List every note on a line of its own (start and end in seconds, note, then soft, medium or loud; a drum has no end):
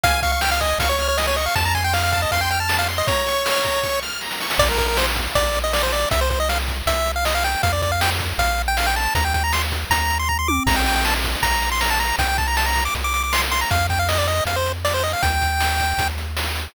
0.03 0.74 C#2 medium
0.03 0.20 F5 medium
0.03 0.22 G#5 loud
0.03 kick loud
0.03 closed hi-hat loud
0.22 0.32 F5 medium
0.22 0.40 C#6 medium
0.22 kick medium
0.22 snare soft
0.22 closed hi-hat medium
0.32 0.41 F5 medium
0.41 0.50 G5 medium
0.41 0.59 F6 medium
0.41 snare loud
0.51 0.60 F5 medium
0.60 0.79 D#5 medium
0.60 0.77 G#5 medium
0.60 kick medium
0.60 closed hi-hat medium
0.78 1.48 C#2 medium
0.78 0.88 F5 medium
0.78 0.98 C#6 medium
0.78 kick medium
0.78 closed hi-hat loud
0.89 1.08 C#5 medium
0.99 1.17 F6 medium
0.99 closed hi-hat medium
1.08 1.17 C#5 medium
1.17 1.26 D#5 medium
1.17 1.35 G#5 medium
1.17 snare medium
1.27 1.36 C#5 medium
1.36 1.45 D#5 medium
1.36 1.55 C#6 medium
1.36 closed hi-hat medium
1.46 1.55 F5 medium
1.55 2.26 F2 medium
1.55 1.64 A5 medium
1.55 1.73 A5 medium
1.55 kick medium
1.55 closed hi-hat medium
1.65 1.74 A#5 medium
1.75 1.84 G#5 medium
1.75 1.92 C6 medium
1.75 kick medium
1.75 snare medium
1.75 closed hi-hat medium
1.84 1.93 G5 medium
1.93 2.03 F5 medium
1.93 2.11 F6 medium
1.93 snare medium
2.03 2.12 F5 medium
2.12 2.21 F5 medium
2.12 2.29 A5 medium
2.12 kick medium
2.12 closed hi-hat medium
2.22 2.31 D#5 medium
2.31 3.03 F2 medium
2.31 2.41 F5 medium
2.31 2.50 C6 medium
2.31 kick medium
2.31 closed hi-hat medium
2.41 2.50 G5 medium
2.50 2.59 G5 medium
2.50 2.69 F6 medium
2.50 closed hi-hat medium
2.60 2.77 A5 medium
2.68 2.85 A5 medium
2.68 snare loud
2.79 2.88 F5 medium
2.88 3.06 C6 medium
2.88 closed hi-hat medium
2.98 3.07 D#5 medium
3.07 4.00 C#5 medium
3.07 3.25 A#5 medium
3.07 kick loud
3.07 closed hi-hat medium
3.26 3.43 C#6 medium
3.26 snare medium
3.26 closed hi-hat medium
3.45 3.62 F6 medium
3.45 snare loud
3.63 3.80 A#5 medium
3.63 kick medium
3.63 closed hi-hat medium
3.83 4.00 C#6 medium
3.83 kick medium
3.83 snare medium
4.03 4.20 F6 medium
4.03 snare medium
4.21 4.40 A#5 medium
4.21 snare medium
4.31 snare medium
4.40 4.58 C#6 medium
4.40 snare medium
4.50 snare loud
4.58 5.28 A#1 medium
4.58 4.68 D5 medium
4.58 kick loud
4.58 crash medium
4.69 4.78 A#4 medium
4.78 4.87 A#4 medium
4.78 kick medium
4.78 snare soft
4.78 closed hi-hat medium
4.88 4.97 A#4 medium
4.97 5.06 C5 medium
4.97 snare loud
5.16 kick medium
5.16 closed hi-hat medium
5.35 6.05 A#1 medium
5.35 5.59 D5 medium
5.35 kick medium
5.35 closed hi-hat medium
5.54 closed hi-hat medium
5.64 5.73 D#5 medium
5.73 5.82 D5 medium
5.73 snare loud
5.83 5.92 C5 medium
5.92 6.09 D5 medium
5.92 closed hi-hat medium
6.11 6.82 C2 medium
6.11 6.20 E5 medium
6.11 kick loud
6.11 closed hi-hat loud
6.21 6.30 C5 medium
6.30 6.39 C5 medium
6.30 kick medium
6.30 snare soft
6.30 closed hi-hat medium
6.40 6.49 D#5 medium
6.49 6.58 F5 medium
6.49 snare medium
6.68 kick medium
6.68 closed hi-hat medium
6.86 7.56 C2 medium
6.86 7.12 E5 medium
6.86 kick medium
6.86 closed hi-hat loud
7.06 closed hi-hat medium
7.16 7.25 F5 medium
7.25 7.34 D#5 medium
7.25 snare loud
7.35 7.44 F5 medium
7.44 7.62 G5 medium
7.44 closed hi-hat medium
7.63 8.33 F2 medium
7.63 7.72 F5 medium
7.63 kick loud
7.63 closed hi-hat medium
7.73 7.82 D5 medium
7.82 7.91 D5 medium
7.82 kick medium
7.82 snare medium
7.82 closed hi-hat medium
7.92 8.01 F5 medium
8.01 8.10 G5 medium
8.01 snare loud
8.20 kick medium
8.20 closed hi-hat medium
8.38 9.08 A#1 medium
8.38 8.62 F5 medium
8.38 kick medium
8.38 closed hi-hat medium
8.58 closed hi-hat medium
8.68 8.77 G5 medium
8.77 8.86 F5 medium
8.77 snare loud
8.86 8.95 G5 medium
8.96 9.14 A5 medium
8.96 closed hi-hat medium
9.15 9.85 D#2 medium
9.15 9.24 A#5 medium
9.15 kick medium
9.15 closed hi-hat loud
9.25 9.34 G5 medium
9.34 9.43 G5 medium
9.34 kick medium
9.34 snare medium
9.34 closed hi-hat medium
9.44 9.53 A#5 medium
9.53 9.62 C6 medium
9.53 snare loud
9.72 kick medium
9.72 closed hi-hat medium
9.90 10.60 D#2 medium
9.90 10.18 A#5 medium
9.90 kick medium
9.90 closed hi-hat loud
10.10 closed hi-hat medium
10.19 10.28 C6 medium
10.29 10.38 A#5 medium
10.29 kick medium
10.39 10.48 C6 medium
10.48 10.63 D6 medium
10.48 high tom loud
10.66 11.36 A#1 medium
10.66 10.76 A#5 medium
10.66 kick loud
10.66 crash loud
10.76 10.85 G5 medium
10.86 10.95 G5 medium
10.86 snare medium
10.86 closed hi-hat medium
10.96 11.05 G5 medium
11.05 11.14 A5 medium
11.05 snare loud
11.24 kick medium
11.24 closed hi-hat medium
11.43 12.13 A#1 medium
11.43 11.70 A#5 medium
11.43 kick medium
11.43 closed hi-hat medium
11.62 closed hi-hat medium
11.72 11.81 C6 medium
11.81 11.90 A#5 medium
11.81 snare loud
11.90 11.99 A5 medium
12.00 12.16 A#5 medium
12.00 closed hi-hat medium
12.18 12.88 C2 medium
12.18 12.28 G5 medium
12.18 kick medium
12.18 closed hi-hat loud
12.28 12.37 G5 medium
12.38 12.47 A5 medium
12.38 kick medium
12.38 snare medium
12.38 closed hi-hat medium
12.47 12.56 A#5 medium
12.57 12.66 A5 medium
12.57 snare loud
12.66 12.84 A#5 medium
12.76 kick medium
12.76 closed hi-hat medium
12.85 12.94 D6 medium
12.95 13.65 C2 medium
12.95 kick medium
12.95 closed hi-hat medium
13.04 13.13 D6 medium
13.14 13.23 D6 medium
13.14 closed hi-hat medium
13.23 13.32 D6 medium
13.33 13.42 C6 medium
13.33 snare loud
13.51 13.60 C6 medium
13.51 closed hi-hat medium
13.61 13.70 A#5 medium
13.70 14.41 F2 medium
13.70 13.87 F5 medium
13.70 kick loud
13.70 closed hi-hat medium
13.89 13.99 G5 medium
13.89 kick medium
13.89 snare medium
13.89 closed hi-hat medium
13.99 14.08 F5 medium
14.09 14.18 D#5 medium
14.09 snare loud
14.18 14.27 D5 medium
14.28 14.44 D#5 medium
14.28 closed hi-hat medium
14.45 15.15 F2 medium
14.45 14.56 F5 medium
14.45 kick medium
14.45 closed hi-hat medium
14.56 14.72 C5 medium
14.66 closed hi-hat medium
14.85 14.94 D5 medium
14.85 snare medium
14.94 15.03 C5 medium
15.03 15.12 D#5 medium
15.03 open hi-hat medium
15.13 15.22 F5 medium
15.22 15.94 D#2 medium
15.22 16.08 G5 medium
15.22 kick loud
15.22 closed hi-hat medium
15.41 kick medium
15.41 snare medium
15.41 closed hi-hat medium
15.60 snare medium
15.80 kick medium
15.80 closed hi-hat medium
15.98 16.68 D#2 medium
15.98 kick medium
15.98 closed hi-hat medium
16.18 closed hi-hat medium
16.37 snare loud
16.55 closed hi-hat medium